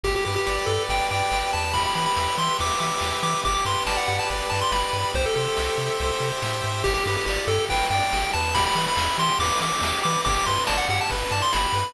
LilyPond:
<<
  \new Staff \with { instrumentName = "Lead 1 (square)" } { \time 4/4 \key g \major \tempo 4 = 141 g'16 g'16 g'16 g'16 g'8 a'8 g''8 g''4 a''8 | b''16 b''16 b''16 b''16 b''8 c'''8 d'''8 d'''4 d'''8 | d'''16 d'''16 c'''8 a''16 fis''16 fis''16 a''16 r8 a''16 c'''16 b''4 | c''16 a'16 a'2~ a'8 r4 |
g'16 g'16 g'16 g'16 g'8 a'8 g''8 g''4 a''8 | b''16 b''16 b''16 b''16 b''8 c'''8 d'''8 d'''4 d'''8 | d'''16 d'''16 c'''8 a''16 fis''16 fis''16 a''16 r8 a''16 c'''16 b''4 | }
  \new Staff \with { instrumentName = "Lead 1 (square)" } { \time 4/4 \key g \major g'8 b'8 d''8 g'8 b'8 d''8 g'8 b'8 | g'8 b'8 e''8 g'8 b'8 e''8 g'8 b'8 | g'8 b'8 d''8 g'8 b'8 d''8 g'8 b'8 | g'8 c''8 e''8 g'8 c''8 e''8 g'8 c''8 |
g'8 b'8 d''8 g'8 b'8 d''8 g'8 b'8 | g'8 b'8 e''8 g'8 b'8 e''8 g'8 b'8 | g'8 b'8 d''8 g'8 b'8 d''8 g'8 b'8 | }
  \new Staff \with { instrumentName = "Synth Bass 1" } { \clef bass \time 4/4 \key g \major g,,8 g,8 g,,8 g,8 g,,8 g,8 g,,8 e,8~ | e,8 e8 e,8 e8 e,8 e8 e,8 e8 | g,,8 g,8 g,,8 g,8 g,,8 g,8 g,,8 g,8 | c,8 c8 c,8 c8 c,8 c8 a,8 gis,8 |
g,,8 g,8 g,,8 g,8 g,,8 g,8 g,,8 e,8~ | e,8 e8 e,8 e8 e,8 e8 e,8 e8 | g,,8 g,8 g,,8 g,8 g,,8 g,8 g,,8 g,8 | }
  \new DrumStaff \with { instrumentName = "Drums" } \drummode { \time 4/4 <cymc bd>8 cymr8 sn8 cymr8 <bd cymr>8 cymr8 sn8 cymr8 | <bd cymr>8 cymr8 sn8 cymr8 <bd cymr>8 cymr8 sn8 cymr8 | <bd cymr>8 <bd cymr>8 sn8 cymr8 <bd cymr>8 cymr8 sn8 cymr8 | <bd cymr>8 cymr8 sn8 cymr8 <bd cymr>8 cymr8 sn8 cymr8 |
<cymc bd>8 cymr8 sn8 cymr8 <bd cymr>8 cymr8 sn8 cymr8 | <bd cymr>8 cymr8 sn8 cymr8 <bd cymr>8 cymr8 sn8 cymr8 | <bd cymr>8 <bd cymr>8 sn8 cymr8 <bd cymr>8 cymr8 sn8 cymr8 | }
>>